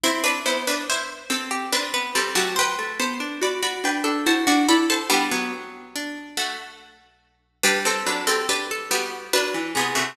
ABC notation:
X:1
M:3/4
L:1/16
Q:1/4=71
K:G
V:1 name="Harpsichord"
[Ec] [DB] [Ec] [DB] [Ec] z [CA]2 [DB]2 [CA] [A,F] | [Bg]2 [ca]2 [db] [db] [Bg]2 [ca] [db] [db] [ca] | [B,G]2 z4 [A,F]6 | [DB] [CA] [DB] [CA] [DB] z [B,G]2 [DB]2 [B,^G] [A,F] |]
V:2 name="Harpsichord"
E2 z5 G B B G G | c2 z5 A F F A A | D B, z2 D8 | G A2 G G A F2 B2 ^G2 |]
V:3 name="Harpsichord"
C2 B,4 C2 C B, G, F, | z A, B, D F F D D E D E2 | G, F,7 z4 | G,2 F,4 G,2 F, E, C, C, |]